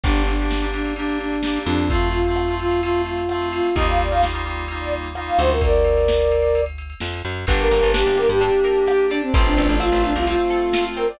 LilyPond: <<
  \new Staff \with { instrumentName = "Flute" } { \time 4/4 \key g \minor \tempo 4 = 129 d'8 d'4 d'8 d'8 d'4 d'8 | f'8 f'4 f'8 f'8 f'4 f'8 | ees''16 f''16 d''16 f''16 r4 r16 d''16 r8. f''16 c''16 bes'16 | <bes' d''>2~ <bes' d''>8 r4. |
r16 bes'8. g'8 bes'16 g'16 g'4. d'16 c'16 | r16 d'8. f'8 d'16 f'16 f'4. bes'16 d''16 | }
  \new Staff \with { instrumentName = "Electric Piano 2" } { \time 4/4 \key g \minor <bes d' g'>8. <bes d' g'>8 <bes d' g'>16 <bes d' g'>8 <bes d' g'>4 <bes d' g'>4 | <a c' f'>8. <a c' f'>8 <a c' f'>16 <a c' f'>8 <a c' f'>4 <a c' f'>4 | <g bes ees' f'>8. <g bes ees' f'>8 <g bes ees' f'>16 <g bes ees' f'>8 <g bes ees' f'>4 <g bes ees' f'>4 | r1 |
<bes d' g'>1 | <a c' f'>1 | }
  \new Staff \with { instrumentName = "Acoustic Guitar (steel)" } { \time 4/4 \key g \minor r1 | r1 | r1 | r1 |
d'8 bes'8 d'8 g'8 d'8 bes'8 g'8 d'8 | c'8 a'8 c'8 f'8 c'8 a'8 f'8 c'8 | }
  \new Staff \with { instrumentName = "Electric Bass (finger)" } { \clef bass \time 4/4 \key g \minor g,,2.~ g,,8 f,8~ | f,1 | ees,2.~ ees,8 d,8~ | d,2. f,8 fis,8 |
g,,8 g,,16 g,,8 g,,8 g,2~ g,16 | a,,8 a,,16 a,,8 a,,8 c,2~ c,16 | }
  \new DrumStaff \with { instrumentName = "Drums" } \drummode { \time 4/4 <cymc bd>16 cymr16 cymr16 cymr16 sn16 cymr16 cymr16 cymr16 cymr16 cymr16 cymr16 cymr16 sn16 cymr16 cymr16 cymr16 | <bd cymr>16 cymr16 cymr16 cymr16 ss16 cymr16 cymr16 cymr16 cymr16 cymr16 cymr16 cymr16 ss16 cymr16 cymr16 cymr16 | <bd cymr>16 cymr16 cymr16 cymr16 sn16 cymr16 cymr16 cymr16 cymr16 cymr16 cymr16 cymr16 ss16 cymr16 cymr16 cymr16 | <bd cymr>16 cymr16 cymr16 cymr16 sn16 cymr16 cymr16 cymr16 cymr16 cymr16 cymr16 cymr16 sn16 cymr16 cymr16 cymr16 |
<bd cymr>8 cymr8 sn8 cymr8 cymr8 cymr8 ss8 cymr8 | <bd cymr>8 cymr8 ss8 cymr8 cymr8 cymr8 sn8 cymr8 | }
>>